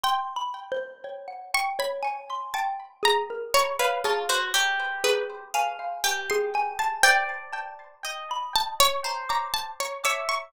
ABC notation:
X:1
M:7/8
L:1/16
Q:1/4=60
K:none
V:1 name="Harpsichord"
g6 _d' b3 a2 _b2 | _d B a c z2 B z3 g c' z a | g6 a _d2 _b a d d _d' |]
V:2 name="Xylophone"
(3c'2 b2 c2 _d _g =g d _a c' g z _A _B | b _d _A2 z2 A2 _a f a A a =a | c z a2 z b z2 _b d' z2 d' _d' |]
V:3 name="Orchestral Harp"
z14 | z f F _G =G4 f2 G4 | d4 _e4 c4 =e2 |]